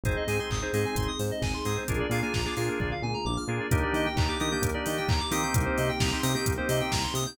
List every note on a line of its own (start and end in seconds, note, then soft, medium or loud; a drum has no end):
0.03 0.16 G#1 medium
0.03 1.85 C4 medium
0.03 0.23 C4 medium
0.03 1.85 D#4 medium
0.03 0.23 D#4 medium
0.03 1.85 G#4 medium
0.03 0.23 G#4 medium
0.03 0.15 C5 medium
0.03 kick loud
0.03 closed hi-hat loud
0.16 0.27 D#5 medium
0.27 0.40 G#2 medium
0.27 0.37 C4 medium
0.27 0.37 D#4 medium
0.27 0.37 G#4 medium
0.27 0.38 G#5 medium
0.27 open hi-hat medium
0.39 0.58 C4 medium
0.39 0.58 D#4 medium
0.39 0.58 G#4 medium
0.39 0.50 C6 medium
0.50 0.63 G#1 medium
0.50 0.61 D#6 medium
0.50 kick loud
0.50 clap loud
0.62 0.71 C4 medium
0.62 0.71 D#4 medium
0.62 0.71 G#4 medium
0.62 0.72 C5 medium
0.73 0.86 G#2 medium
0.73 1.10 C4 medium
0.73 1.10 D#4 medium
0.73 1.10 G#4 medium
0.73 0.84 D#5 medium
0.73 open hi-hat medium
0.85 0.95 G#5 medium
0.96 1.08 G#1 medium
0.96 1.06 C6 medium
0.96 kick loud
0.96 closed hi-hat loud
1.08 1.18 D#6 medium
1.19 1.32 G#2 medium
1.19 1.30 C5 medium
1.19 open hi-hat medium
1.31 1.41 D#5 medium
1.42 1.54 G#1 medium
1.42 1.52 G#5 medium
1.42 kick loud
1.42 snare loud
1.54 1.64 C6 medium
1.65 1.78 G#2 medium
1.65 1.84 C4 medium
1.65 1.84 D#4 medium
1.65 1.84 G#4 medium
1.65 1.76 D#6 medium
1.65 open hi-hat medium
1.77 1.87 C5 medium
1.87 2.02 A#1 medium
1.87 3.68 A#3 medium
1.87 2.06 A#3 medium
1.87 3.68 D4 medium
1.87 2.06 D4 medium
1.87 3.68 F4 medium
1.87 2.06 F4 medium
1.87 3.68 G#4 medium
1.87 2.06 G#4 medium
1.87 1.99 A#4 medium
1.87 kick loud
1.87 closed hi-hat loud
2.00 2.10 D5 medium
2.10 2.22 A#2 medium
2.10 2.20 A#3 medium
2.10 2.20 D4 medium
2.10 2.20 F4 medium
2.10 2.20 G#4 medium
2.10 2.21 F5 medium
2.10 open hi-hat medium
2.22 2.41 A#3 medium
2.22 2.41 D4 medium
2.22 2.41 F4 medium
2.22 2.41 G#4 medium
2.22 2.33 G#5 medium
2.34 2.47 A#1 medium
2.34 2.44 A#5 medium
2.34 kick loud
2.34 snare loud
2.45 2.55 A#3 medium
2.45 2.55 D4 medium
2.45 2.55 F4 medium
2.45 2.55 G#4 medium
2.45 2.56 D6 medium
2.56 2.69 A#2 medium
2.56 2.94 A#3 medium
2.56 2.94 D4 medium
2.56 2.94 F4 medium
2.56 2.94 G#4 medium
2.56 2.67 F6 medium
2.56 open hi-hat medium
2.68 2.79 A#4 medium
2.80 2.93 A#1 medium
2.80 2.90 D5 medium
2.80 kick loud
2.80 floor tom loud
2.91 3.02 F5 medium
3.02 3.15 A#2 medium
3.02 3.13 G#5 medium
3.02 mid tom loud
3.14 3.24 A#5 medium
3.25 3.38 A#1 medium
3.25 3.36 D6 medium
3.25 high tom medium
3.37 3.47 F6 medium
3.48 3.60 A#2 medium
3.48 3.67 A#3 medium
3.48 3.67 D4 medium
3.48 3.67 F4 medium
3.48 3.67 G#4 medium
3.48 3.59 A#4 medium
3.60 3.70 D5 medium
3.71 3.84 D#2 loud
3.71 4.08 A#3 loud
3.71 5.53 A#3 medium
3.71 4.08 D4 loud
3.71 5.53 D4 medium
3.71 4.08 D#4 loud
3.71 5.53 D#4 medium
3.71 4.08 G4 loud
3.71 5.53 G4 medium
3.71 3.82 A#4 loud
3.71 kick loud
3.71 closed hi-hat loud
3.82 3.93 D5 medium
3.93 4.06 D#3 medium
3.93 4.04 D#5 medium
3.93 open hi-hat medium
4.06 4.16 G5 medium
4.16 4.29 D#2 medium
4.16 4.26 A#3 medium
4.16 4.26 D4 medium
4.16 4.26 D#4 medium
4.16 4.26 G4 medium
4.16 4.27 A#5 medium
4.16 kick loud
4.16 clap loud
4.28 4.38 A#3 medium
4.28 4.38 D4 medium
4.28 4.38 D#4 medium
4.28 4.38 G4 medium
4.28 4.39 D6 medium
4.40 4.53 D#3 medium
4.40 4.49 A#3 medium
4.40 4.49 D4 medium
4.40 4.49 D#4 medium
4.40 4.49 G4 medium
4.40 4.50 D#6 medium
4.40 open hi-hat medium
4.52 4.70 A#3 medium
4.52 4.70 D4 medium
4.52 4.70 D#4 medium
4.52 4.70 G4 medium
4.52 4.62 G6 medium
4.62 4.75 D#2 medium
4.62 4.73 A#4 medium
4.62 kick loud
4.62 closed hi-hat loud
4.74 5.11 A#3 medium
4.74 5.11 D4 medium
4.74 5.11 D#4 medium
4.74 5.11 G4 medium
4.74 4.84 D5 medium
4.86 4.99 D#3 medium
4.86 4.96 D#5 medium
4.86 open hi-hat loud
4.97 5.08 G5 medium
5.08 5.21 D#2 medium
5.08 5.19 A#5 medium
5.08 kick loud
5.08 clap loud
5.20 5.30 D6 medium
5.31 5.44 D#3 medium
5.31 5.91 A#3 loud
5.31 5.91 C4 loud
5.31 5.91 D#4 medium
5.31 5.91 G4 loud
5.31 5.42 D#6 medium
5.31 open hi-hat loud
5.43 5.53 G6 medium
5.54 5.67 C2 loud
5.54 7.36 A#3 medium
5.54 7.36 C4 medium
5.54 7.36 D#4 medium
5.54 7.36 G4 medium
5.54 5.65 A#4 medium
5.54 kick loud
5.54 closed hi-hat loud
5.66 5.76 C5 medium
5.77 5.91 C3 medium
5.77 5.88 D#5 medium
5.77 open hi-hat medium
5.89 5.99 G5 medium
6.00 6.13 C2 medium
6.00 6.09 A#3 medium
6.00 6.09 C4 medium
6.00 6.09 D#4 medium
6.00 6.09 G4 medium
6.00 6.10 A#5 medium
6.00 kick loud
6.00 snare loud
6.12 6.21 A#3 medium
6.12 6.21 C4 medium
6.12 6.21 D#4 medium
6.12 6.21 G4 medium
6.12 6.22 C6 medium
6.23 6.36 C3 medium
6.23 6.32 A#3 medium
6.23 6.32 C4 medium
6.23 6.32 D#4 medium
6.23 6.32 G4 medium
6.23 6.33 D#6 medium
6.23 open hi-hat loud
6.35 6.53 A#3 medium
6.35 6.53 C4 medium
6.35 6.53 D#4 medium
6.35 6.53 G4 medium
6.35 6.45 G6 medium
6.46 6.59 C2 medium
6.46 6.56 A#4 medium
6.46 kick loud
6.46 closed hi-hat loud
6.58 6.94 A#3 medium
6.58 6.94 C4 medium
6.58 6.94 D#4 medium
6.58 6.94 G4 medium
6.58 6.68 C5 medium
6.69 6.81 C3 medium
6.69 6.79 D#5 medium
6.69 open hi-hat loud
6.81 6.91 G5 medium
6.92 7.05 C2 medium
6.92 7.02 A#5 medium
6.92 kick loud
6.92 snare loud
7.03 7.14 C6 medium
7.14 7.26 C3 medium
7.14 7.25 D#6 medium
7.14 open hi-hat loud
7.26 7.37 G6 medium